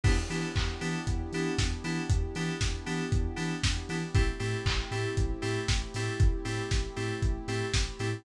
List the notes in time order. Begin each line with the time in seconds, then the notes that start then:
0.03 E2 B3 D4 E4 G4, kick, crash
0.30 E3 B3 D4 E4 G4, open hi-hat
0.56 E2, kick, clap
0.81 E3 B3 D4 E4 G4, open hi-hat
1.07 E2, kick, closed hi-hat
1.32 E3 B3 D4 E4 G4, open hi-hat
1.58 E2, kick, snare
1.84 E3 B3 D4 E4 G4, open hi-hat
2.10 E2, kick, closed hi-hat
2.35 E3 B3 D4 E4 G4, open hi-hat
2.61 E2, kick, snare
2.86 E3 B3 D4 E4 G4, open hi-hat
3.12 E2, kick, closed hi-hat
3.36 E3 B3 D4 E4 G4, open hi-hat
3.63 E2, kick, snare
3.89 E3 B3 D4 E4 G4, open hi-hat
4.15 A1 A3 C4 E4 G4, kick, closed hi-hat
4.39 A2 A3 C4 E4 G4, open hi-hat
4.66 A1, kick, clap
4.91 A2 A3 C4 E4 G4, open hi-hat
5.17 A1, kick, closed hi-hat
5.42 A2 A3 C4 E4 G4, open hi-hat
5.68 A1, kick, snare
5.94 A2 A3 C4 E4 G4, open hi-hat
6.20 A1, kick, closed hi-hat
6.45 A2 A3 C4 E4 G4, open hi-hat
6.71 A1, kick, snare
6.96 A2 A3 C4 E4 G4, open hi-hat
7.22 A1, kick, closed hi-hat
7.48 A2 A3 C4 E4 G4, open hi-hat
7.74 A1, kick, snare
7.99 A2 A3 C4 E4 G4, open hi-hat